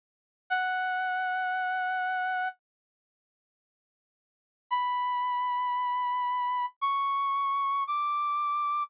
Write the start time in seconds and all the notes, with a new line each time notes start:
0.50 F#5
4.71 B5
6.81 C#6
7.87 D6